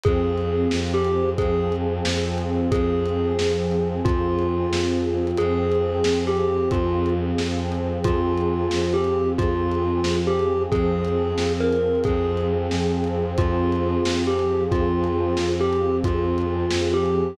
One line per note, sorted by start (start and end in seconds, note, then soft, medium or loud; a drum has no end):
0.04 0.67 F2 loud
0.04 1.37 F3 medium
0.04 1.37 C4 loud
0.04 0.80 G#4 loud
0.04 1.37 G#4 medium
0.04 kick loud
0.04 closed hi-hat medium
0.38 closed hi-hat medium
0.71 1.34 F2 loud
0.71 snare loud
0.94 1.30 G4 loud
1.05 closed hi-hat medium
1.38 1.99 F2 loud
1.38 2.71 F3 loud
1.38 2.71 C4 loud
1.38 1.75 G#4 loud
1.38 2.71 G#4 loud
1.38 kick loud
1.38 closed hi-hat loud
1.72 closed hi-hat medium
2.05 2.66 F2 medium
2.05 snare loud
2.38 closed hi-hat medium
2.71 3.33 F2 loud
2.71 4.03 F3 loud
2.71 4.03 C4 medium
2.71 4.03 G#4 loud
2.71 3.80 G#4 loud
2.71 kick loud
2.71 closed hi-hat loud
3.06 closed hi-hat medium
3.39 4.00 F2 medium
3.39 snare loud
3.71 closed hi-hat medium
4.05 4.67 F2 loud
4.05 5.38 F3 medium
4.05 5.38 C4 medium
4.05 5.34 F4 loud
4.05 5.38 G#4 medium
4.05 kick loud
4.05 closed hi-hat loud
4.39 closed hi-hat medium
4.71 5.32 F2 medium
4.71 snare loud
5.27 closed hi-hat medium
5.37 6.00 F2 loud
5.37 6.71 F3 medium
5.37 6.71 C4 loud
5.37 6.25 G#4 loud
5.37 6.71 G#4 loud
5.37 closed hi-hat loud
5.72 closed hi-hat medium
6.04 6.66 F2 medium
6.04 snare loud
6.27 6.69 G4 loud
6.37 closed hi-hat medium
6.70 7.31 F2 loud
6.70 8.04 F3 loud
6.70 8.04 C4 medium
6.70 7.10 F4 loud
6.70 8.04 G#4 medium
6.70 kick loud
6.70 closed hi-hat loud
7.06 closed hi-hat medium
7.37 7.98 F2 medium
7.37 snare medium
7.72 closed hi-hat medium
8.04 8.67 F2 loud
8.04 9.37 F3 loud
8.04 9.37 C4 loud
8.04 8.91 F4 loud
8.04 9.37 G#4 medium
8.04 kick loud
8.04 closed hi-hat loud
8.37 closed hi-hat medium
8.71 9.34 F2 medium
8.71 snare loud
8.94 9.30 G4 loud
9.04 closed hi-hat medium
9.38 10.00 F2 loud
9.38 10.70 F3 medium
9.38 10.70 C4 medium
9.38 10.16 F4 loud
9.38 10.70 G#4 medium
9.38 kick loud
9.38 closed hi-hat loud
9.72 closed hi-hat medium
10.04 10.65 F2 medium
10.04 snare loud
10.27 10.63 G4 loud
10.39 closed hi-hat medium
10.71 11.33 F2 loud
10.71 12.03 F3 loud
10.71 12.03 C4 loud
10.71 12.03 G#4 loud
10.71 11.52 G#4 loud
10.71 kick loud
10.71 closed hi-hat medium
11.05 closed hi-hat medium
11.37 11.99 F2 medium
11.37 snare loud
11.60 12.00 A#4 loud
11.72 closed hi-hat medium
11.95 closed hi-hat soft
12.04 12.67 F2 loud
12.04 13.36 F3 loud
12.04 13.36 C4 loud
12.04 13.36 G#4 loud
12.04 12.47 G#4 loud
12.04 kick loud
12.04 closed hi-hat loud
12.37 closed hi-hat medium
12.71 13.33 F2 medium
12.71 snare medium
13.04 closed hi-hat medium
13.38 13.99 F2 loud
13.38 14.70 F3 loud
13.38 14.70 C4 loud
13.38 14.19 F4 loud
13.38 14.70 G#4 loud
13.38 kick loud
13.38 closed hi-hat loud
13.72 closed hi-hat medium
14.04 14.66 F2 medium
14.04 snare loud
14.27 14.64 G4 medium
14.39 closed hi-hat medium
14.70 15.33 F2 loud
14.70 16.02 F3 loud
14.70 16.02 C4 loud
14.70 15.49 F4 loud
14.70 16.02 G#4 medium
14.70 kick loud
14.70 closed hi-hat medium
15.04 closed hi-hat medium
15.37 15.99 F2 medium
15.37 snare loud
15.60 15.97 G4 loud
15.73 closed hi-hat medium
16.04 16.65 F2 loud
16.04 17.37 F3 medium
16.04 17.37 C4 medium
16.04 16.91 F4 loud
16.04 17.37 G#4 medium
16.04 kick loud
16.04 closed hi-hat loud
16.38 closed hi-hat medium
16.71 17.34 F2 medium
16.71 snare loud
16.94 17.35 G4 loud
17.06 closed hi-hat medium